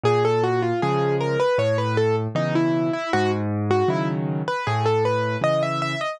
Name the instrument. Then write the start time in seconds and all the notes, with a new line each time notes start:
acoustic grand piano
0.04 A#2 G#4
0.25 A4
0.43 F#4
0.62 F4
0.82 C#3 F3 G#3 G#4
1.21 A#4
1.40 B4
1.58 A2 C#5
1.78 B4
1.97 A4
2.35 B2 C#3 E3 D#4
2.55 E4
2.93 E4
3.13 G#2 F#4
3.71 F#4
3.88 C#3 D#3 F#3 E4
4.48 B4
4.67 A2 G#4
4.86 A4
5.05 B4
5.42 C#3 E3 D#5
5.63 E5
5.82 E5
6.01 D#5